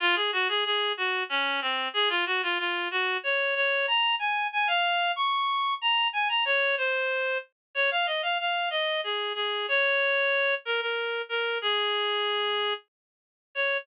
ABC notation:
X:1
M:3/4
L:1/16
Q:1/4=93
K:Db
V:1 name="Clarinet"
F A G A A2 G2 D2 C2 | A F G F F2 G2 d2 d2 | b2 a2 a f3 d'4 | b2 a b d2 c4 z2 |
d f e f f2 e2 A2 A2 | d6 B B3 B2 | A8 z4 | d4 z8 |]